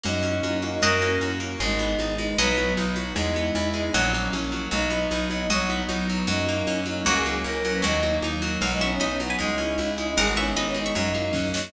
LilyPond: <<
  \new Staff \with { instrumentName = "Pizzicato Strings" } { \time 2/4 \key b \major \tempo 4 = 154 r2 | <fis' dis''>4. r8 | r2 | <fis' dis''>4. r8 |
r2 | <fis' dis''>4. r8 | r2 | <fis' dis''>4. r8 |
r2 | <ais fis'>4. r8 | <ais' fis''>4 r4 | f''16 r16 <e'' cis'''>8 <dis'' b''>8. <b' gis''>16 |
r2 | <ais' fis''>16 r16 <e'' cis'''>8 <dis'' b''>8. <e'' cis'''>16 | r2 | }
  \new Staff \with { instrumentName = "Choir Aahs" } { \time 2/4 \key b \major dis'4. dis'16 dis'16 | ais'4 r4 | dis'4. dis'16 dis'16 | b'4 r4 |
dis'4. dis'16 dis'16 | fis8 r4. | dis'4. dis'16 dis'16 | fis4 r4 |
dis'4. dis'16 dis'16 | fis'16 gis'16 gis'16 r16 ais'8. b'16 | dis'4 r4 | fis16 gis16 cis'16 cis'8 cis'16 b8 |
dis'4. dis'16 dis'16 | gis'16 fis'16 cis'16 cis'8 cis'16 dis'8 | dis'4. dis'16 dis'16 | }
  \new Staff \with { instrumentName = "Orchestral Harp" } { \time 2/4 \key b \major ais8 cis'8 fis'8 ais8 | ais8 cis'8 fis'8 ais8 | gis8 b8 dis'8 gis8 | fis8 b8 dis'8 fis8 |
gis8 b8 e'8 gis8 | fis8 ais8 cis'8 fis8 | fis8 b8 dis'8 fis8 | fis8 b8 dis'8 fis8 |
fis8 ais8 cis'8 fis8 | fis8 ais8 cis'8 fis8 | fis8 ais8 dis'8 fis8 | fis8 b8 dis'8 fis8 |
gis8 cis'8 e'8 gis8 | gis8 b8 dis'8 gis8 | fis8 ais8 cis'8 fis8 | }
  \new Staff \with { instrumentName = "Electric Bass (finger)" } { \clef bass \time 2/4 \key b \major fis,4 fis,4 | fis,4 fis,4 | gis,,4 gis,,4 | b,,4 b,,4 |
e,4 e,4 | ais,,4 ais,,4 | b,,4 b,,4 | b,,4 b,,4 |
fis,4 fis,4 | cis,4 cis,4 | dis,4 dis,4 | b,,4 b,,4 |
cis,4 cis,4 | gis,,4 gis,,4 | fis,4 fis,4 | }
  \new Staff \with { instrumentName = "Pad 2 (warm)" } { \time 2/4 \key b \major <ais cis' fis'>2 | <ais cis' fis'>2 | <gis b dis'>2 | <fis b dis'>2 |
<gis b e'>2 | <fis ais cis'>2 | <fis b dis'>2 | <fis b dis'>2 |
<fis ais cis'>2 | <fis ais cis'>2 | <fis ais dis'>2 | <fis b dis'>2 |
<gis cis' e'>2 | <gis b dis'>2 | <fis ais cis'>2 | }
  \new DrumStaff \with { instrumentName = "Drums" } \drummode { \time 2/4 <cgl cb>8 cgho8 <cgho cb>8 cgho8 | <cgl cb>8 cgho8 <cgho cb>8 cgho8 | <cgl cb>8 cgho8 <cgho cb>8 cgho8 | <cgl cb>8 cgho8 <cgho cb>8 cgho8 |
<cgl cb>8 cgho8 <cgho cb>8 cgho8 | <cgl cb>8 cgho8 <cgho cb>8 cgho8 | <cgl cb>8 cgho8 <cgho cb>8 cgho8 | <cgl cb>8 cgho8 <cgho cb>8 cgho8 |
<cgl cb>8 cgho8 <cgho cb>8 cgho8 | <cgl cb>8 cgho8 <cgho cb>8 cgho8 | <cgl cb>8 cgho8 <cgho cb>8 cgho8 | <cgl cb>8 cgho8 <cgho cb>8 cgho8 |
<cgl cb>8 cgho8 <cgho cb>8 cgho8 | <cgl cb>8 cgho8 <cgho cb>8 cgho8 | <cgl cb>8 cgho8 <bd sn>8 sn8 | }
>>